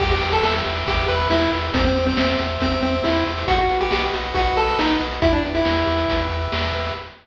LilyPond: <<
  \new Staff \with { instrumentName = "Lead 1 (square)" } { \time 4/4 \key e \minor \tempo 4 = 138 g'16 g'8 a'16 a'16 r8. g'8 b'8 e'8 r8 | c'16 c'8 c'16 c'16 r8. c'8 c'8 e'8 r8 | fis'16 fis'8 g'16 g'16 r8. fis'8 a'8 dis'8 r8 | e'16 d'16 r16 e'4.~ e'16 r4. | }
  \new Staff \with { instrumentName = "Lead 1 (square)" } { \time 4/4 \key e \minor g'8 b'8 e''8 g'8 b'8 e''8 g'8 b'8 | g'8 c''8 e''8 g'8 c''8 e''8 g'8 c''8 | fis'8 b'8 dis''8 fis'8 b'8 dis''8 fis'8 b'8 | g'8 b'8 e''8 g'8 b'8 e''8 g'8 b'8 | }
  \new Staff \with { instrumentName = "Synth Bass 1" } { \clef bass \time 4/4 \key e \minor e,8 e,8 e,8 e,8 e,8 e,8 e,8 e,8 | e,8 e,8 e,8 e,8 e,8 e,8 e,8 e,8 | b,,8 b,,8 b,,8 b,,8 b,,8 b,,8 b,,8 b,,8 | e,8 e,8 e,8 e,8 e,8 e,8 e,8 e,8 | }
  \new DrumStaff \with { instrumentName = "Drums" } \drummode { \time 4/4 <cymc bd>16 hh16 hh16 hh16 sn16 hh16 hh16 hh16 <hh bd>16 hh16 hh16 hh16 sn16 hh16 hh16 hh16 | <hh bd>16 hh16 hh16 hh16 sn16 hh16 hh16 hh16 <hh bd>16 hh16 hh16 hh16 sn16 hh16 hh16 hh16 | <hh bd>16 hh16 hh16 hh16 sn16 hh16 hh16 hh16 <hh bd>16 hh16 hh16 hh16 sn16 hh16 hh16 hh16 | <hh bd>16 hh16 hh16 hh16 sn16 hh16 hh16 hh16 <hh bd>16 hh16 hh16 hh16 sn16 hh16 hh16 hh16 | }
>>